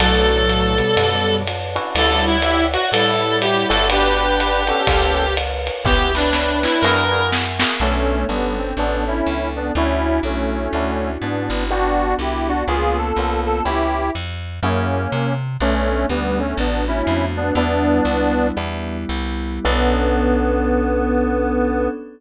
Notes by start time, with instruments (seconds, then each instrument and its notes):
0.00 electric bass (finger) B1, lead 1 (square) A2 F#3, electric piano 1 B3 C#4 D4 A4, clarinet A4, pad 5 (bowed) B4 C#5 D5 A5, ride
0.49 hi-hat pedal, ride
0.78 lead 1 (square) B2 G3, ride
0.97 electric bass (finger) F#2, ride
1.47 hi-hat pedal, ride
1.75 electric piano 1 C#4 D4 E4 F#4, ride
1.95 electric bass (finger) D2, lead 1 (square) G3 E4, clarinet A4, pad 5 (bowed) C#5 D5 E5 F#5, ride
2.27 clarinet E4
2.42 lead 1 (square) G4 E5, hi-hat pedal, ride
2.73 clarinet F#4, ride
2.92 electric bass (finger) A2, lead 1 (square) G3 E4, clarinet A4, ride
3.41 clarinet G4, hi-hat pedal, ride
3.69 electric bass (finger) G1, electric piano 1 B3 D4 F#4 G4, clarinet A4, ride
3.90 lead 1 (square) D4 B4, clarinet G4, pad 5 (bowed) B4 D5 F#5 G5, ride
4.39 hi-hat pedal, ride
4.67 electric piano 1 B3 D4 F#4 G4, lead 1 (square) C#4 A4, ride
4.87 electric bass (finger) C#2, electric piano 1 A#3 B3 C#4 F4, pad 5 (bowed) A#4 B4 C#5 F5, kick, ride
5.37 hi-hat pedal, ride
5.67 ride
5.85 electric bass (finger) C#2, electric piano 1 B3 C#4 E4 G4, lead 1 (square) B3 G4, clarinet G4, pad 5 (bowed) B4 C#5 E5 G5, kick, snare
6.14 lead 1 (square) D4 B4, clarinet D4, snare
6.33 snare
6.63 clarinet E4, snare
6.81 electric bass (finger) F#2, electric piano 1 A#3 E4 F#4 G#4, clarinet A#4, pad 5 (bowed) A#4 E5 F#5 G#5, snare
7.11 electric piano 1 A#3 E4 F#4 G#4
7.32 snare
7.59 electric piano 1 A#3 E4 F#4 G#4, snare
7.80 electric bass (finger) B1, lead 1 (square) A3 C#4, electric piano 1 B3 C#4 D4 A4, pad 5 (bowed) B3 C#4 D4 A4
8.29 electric bass (finger) G1, lead 1 (square) G3 B3, electric piano 1 B3 C#4 D4 A4
8.58 lead 1 (square) C4
8.77 electric bass (finger) A1, lead 1 (square) B3 D4, electric piano 1 B3 C#4 D4 A4
9.07 lead 1 (square) C#4 E4
9.27 electric bass (finger) C#2
9.56 lead 1 (square) B3 D4
9.75 electric bass (finger) D2, lead 1 (square) C#4 E4, pad 5 (bowed) C#4 D4 E4 F#4, electric piano 1 C#4 D4 E4 F#4
10.23 electric bass (finger) B1, lead 1 (square) A3 C#4
10.73 electric bass (finger) D2, electric piano 1 C#4 D4 E4 F#4
11.22 electric bass (finger) G#2, lead 1 (square) B3 D4
11.50 electric bass (finger) G1
11.70 electric piano 1 B3 D4 F#4 G4, pad 5 (bowed) B3 D4 F#4 G4, lead 1 (square) D4 F#4
12.19 electric bass (finger) C2, lead 1 (square) E4 G4
12.48 lead 1 (square) D4 F#4
12.68 electric bass (finger) C#2, pad 5 (bowed) A#3 B3 C#4 F4, electric piano 1 A#3 B3 C#4 F4, lead 1 (square) F4 G#4
12.98 lead 1 (square) A4
13.16 electric bass (finger) C2, electric piano 1 A#3 B3 C#4 F4
13.46 lead 1 (square) A4
13.65 electric bass (finger) C#2, electric piano 1 B3 C#4 E4 G4, lead 1 (square) E4 G4
14.15 electric bass (finger) F2
14.63 electric bass (finger) F#2, lead 1 (square) A#3 C#4, electric piano 1 A#3 E4 F#4 G#4
15.12 electric bass (finger) C3
15.60 electric bass (finger) B1, pad 5 (bowed) A3 B3 C#4 D4, lead 1 (square) A3 C#4, electric piano 1 A3 B3 C#4 D4
16.09 electric bass (finger) D2, lead 1 (square) G3 B3
16.39 lead 1 (square) A3 C#4
16.57 electric bass (finger) A1, pad 5 (bowed) A3 B3 D4 F#4, lead 1 (square) B3 D4
16.88 lead 1 (square) C#4 E4
17.07 electric bass (finger) F2
17.37 lead 1 (square) B3 D4
17.55 electric bass (finger) E2, pad 5 (bowed) G3 B3 D4 E4, electric piano 1 G3 B3 D4 E4, lead 1 (square) B3 D4
18.05 electric bass (finger) C#2
18.56 electric bass (finger) E2, pad 5 (bowed) G3 B3 E4 G4, electric piano 1 G3 B3 D4 E4
19.09 electric bass (finger) C2
19.65 electric bass (finger) B1, electric piano 1 B3 C#4 D4 A4, lead 1 (square) B3, pad 5 (bowed) B3 C#4 D4 A4